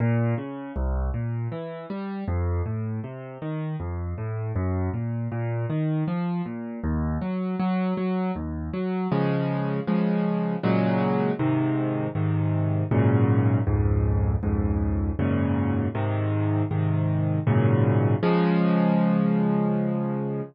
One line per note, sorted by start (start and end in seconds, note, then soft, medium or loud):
0.00 0.34 A#2 loud
0.38 0.72 C#3 medium
0.76 1.10 C2 loud
1.14 1.48 A#2 medium
1.52 1.86 E3 medium
1.90 2.24 G3 medium
2.28 2.62 F2 loud
2.66 3.00 A2 medium
3.04 3.38 C3 medium
3.42 3.76 D#3 medium
3.80 4.14 F2 medium
4.18 4.52 A2 medium
4.56 4.90 F#2 loud
4.94 5.28 A#2 medium
5.32 5.66 A#2 loud
5.70 6.04 D#3 medium
6.08 6.42 F3 medium
6.46 6.80 A#2 medium
6.84 7.18 D#2 loud
7.22 7.56 F#3 medium
7.59 7.94 F#3 loud
7.97 8.31 F#3 medium
8.35 8.70 D#2 medium
8.73 9.08 F#3 medium
9.12 9.80 C#3 loud
9.12 9.80 F3 medium
9.12 9.80 G#3 medium
9.87 10.56 C#3 medium
9.87 10.56 F3 medium
9.87 10.56 G#3 medium
10.63 11.32 A#2 loud
10.63 11.32 C#3 medium
10.63 11.32 F#3 loud
10.63 11.32 G#3 loud
11.39 12.08 G#2 medium
11.39 12.08 C3 loud
11.39 12.08 D#3 medium
12.15 12.83 G#2 medium
12.15 12.83 C3 medium
12.15 12.83 D#3 medium
12.91 13.60 F#2 loud
12.91 13.60 G#2 medium
12.91 13.60 A#2 loud
12.91 13.60 C#3 medium
13.67 14.35 C#2 medium
13.67 14.35 F2 medium
13.67 14.35 G#2 medium
14.43 15.11 C#2 medium
14.43 15.11 F2 medium
14.43 15.11 G#2 medium
15.19 15.87 F#2 medium
15.19 15.87 G#2 medium
15.19 15.87 A#2 loud
15.19 15.87 C#3 loud
15.95 16.63 G#2 medium
15.95 16.63 C3 loud
15.95 16.63 D#3 medium
16.71 17.39 G#2 medium
16.71 17.39 C3 medium
16.71 17.39 D#3 medium
17.47 18.15 F#2 loud
17.47 18.15 G#2 medium
17.47 18.15 A#2 loud
17.47 18.15 C#3 loud
18.23 20.42 C#3 loud
18.23 20.42 F3 loud
18.23 20.42 G#3 loud